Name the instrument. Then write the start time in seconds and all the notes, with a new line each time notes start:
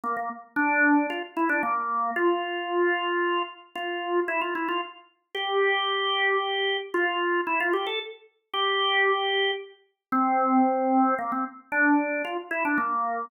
drawbar organ
0.04 A#3
0.17 A#3
0.56 D4
1.10 F4
1.37 E4
1.49 D4
1.63 A#3
2.16 F4
3.75 F4
4.28 E4
4.41 F4
4.55 E4
4.68 F4
5.35 G4
6.94 F4
7.47 E4
7.60 F4
7.73 G4
7.87 A4
8.54 G4
10.12 C4
11.19 A#3
11.32 C4
11.72 D4
12.25 F4
12.51 E4
12.65 D4
12.78 A#3